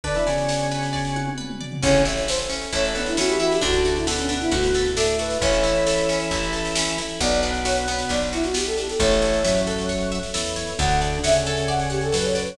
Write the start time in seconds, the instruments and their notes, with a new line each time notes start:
0.03 drawbar organ D3 D4, pad 2 (warm) B3 D4 F#4, orchestral harp B4, flute D5, kick, snare
0.15 drawbar organ E3 E4, snare
0.26 drawbar organ C#3 C#4, orchestral harp D5, snare
0.38 snare
0.49 orchestral harp F#5, snare
0.60 snare
0.71 orchestral harp B4, snare
0.83 snare
0.93 orchestral harp D5, kick, snare
1.05 snare
1.16 orchestral harp F#5, high tom
1.27 high tom
1.38 orchestral harp B4, mid tom
1.50 mid tom
1.61 orchestral harp D5, floor tom
1.72 floor tom
1.82 electric bass (finger) A1, drawbar organ C#3 C#4, orchestral harp C#4, pad 2 (warm) C#4 E4 A4, flute C#5, kick, snare, crash
1.95 snare
2.05 orchestral harp E4, snare
2.17 snare
2.28 orchestral harp A4, flute C5, snare
2.39 snare
2.50 orchestral harp C#4, snare
2.61 snare
2.72 electric bass (finger) A1, drawbar organ A3 A4, orchestral harp E4, flute C#5, kick, snare
2.84 snare
2.95 drawbar organ B3 B4, flute D4, orchestral harp A4, snare
3.06 flute E4, snare
3.17 drawbar organ E3 E4, orchestral harp C#4, flute F#4, snare
3.29 flute G4, snare
3.40 orchestral harp E4, flute F#4, snare
3.50 flute G4, snare
3.61 electric bass (finger) D2, drawbar organ D3 D4, orchestral harp D4, pad 2 (warm) D4 F#4 A4, flute F#4, kick, snare
3.73 snare
3.85 orchestral harp F#4, snare
3.95 flute E4, snare
4.07 drawbar organ B2 B3, flute D4, orchestral harp A4, snare
4.18 flute C#4, snare
4.29 orchestral harp D4, flute D4, snare
4.40 flute E4, snare
4.51 electric bass (finger) D2, orchestral harp F#4, flute F#4, kick, snare
4.63 snare
4.74 orchestral harp A4, snare
4.85 snare
4.96 drawbar organ A2 A3, orchestral harp D4, flute A4, snare
5.07 snare
5.19 orchestral harp F#4, flute B4, snare
5.30 snare
5.41 electric bass (finger) A1, drawbar organ E3 E4, pad 2 (warm) C#4 E4 A4, orchestral harp C#4, flute C#5, kick, snare
5.53 snare
5.63 orchestral harp E4, snare
5.75 snare
5.86 orchestral harp A4, snare
5.98 snare
6.09 orchestral harp C#4, snare
6.20 snare
6.31 electric bass (finger) A1, orchestral harp E4, kick, snare
6.43 snare
6.53 orchestral harp A4, snare
6.65 snare
6.75 orchestral harp C#4, snare
6.87 snare
6.98 orchestral harp E4, snare
7.09 snare
7.20 electric bass (finger) B1, drawbar organ B2 B3, pad 2 (warm) B3 D4 F#4, orchestral harp B3, flute D5, kick, snare
7.32 snare
7.42 orchestral harp D4, snare
7.54 snare
7.65 orchestral harp F#4, flute C#5, snare
7.77 snare
7.88 orchestral harp B3, snare
7.99 snare
8.09 electric bass (finger) B1, orchestral harp D4, flute D5, kick, snare
8.21 snare
8.32 flute E4, orchestral harp F#4, snare
8.43 flute F#4, snare
8.54 orchestral harp B3, flute G4, snare
8.66 flute A4, snare
8.77 orchestral harp D4, flute G4, snare
8.88 flute A4, snare
8.99 electric bass (finger) A1, drawbar organ A2 A3, pad 2 (warm) A4 C#5 E5, orchestral harp A4, flute C#5, kick, snare
9.11 snare
9.22 orchestral harp C#5, snare
9.33 snare
9.44 drawbar organ F#2 F#3, orchestral harp E5, snare
9.55 snare
9.67 orchestral harp A4, snare
9.78 snare
9.89 orchestral harp C#5, kick, snare
10.00 snare
10.12 orchestral harp E5, snare
10.23 snare
10.34 drawbar organ E2 E3, orchestral harp A4, snare
10.45 snare
10.56 orchestral harp C#5, snare
10.67 snare
10.79 electric bass (finger) D2, drawbar organ D3 D4, pad 2 (warm) A4 D5 F#5, orchestral harp A4, flute F#5, kick, snare
10.90 snare
11.01 orchestral harp D5, snare
11.13 snare
11.23 drawbar organ C#3 C#4, flute E5, orchestral harp F#5, snare
11.35 snare
11.46 orchestral harp A4, snare
11.57 snare
11.68 orchestral harp D5, flute F#5, kick, snare
11.79 snare
11.90 flute G4, orchestral harp F#5, snare
12.01 flute A4, snare
12.12 drawbar organ F#2 F#3, orchestral harp A4, flute B4, snare
12.24 flute C#5, snare
12.35 flute B4, orchestral harp D5, snare
12.47 flute C#5, snare